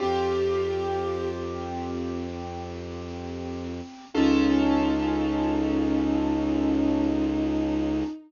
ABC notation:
X:1
M:4/4
L:1/8
Q:1/4=58
K:Eblyd
V:1 name="Violin"
G3 z5 | E8 |]
V:2 name="Acoustic Grand Piano"
[CFG]8 | [_DFA]8 |]
V:3 name="Violin" clef=bass
F,,8 | _D,,8 |]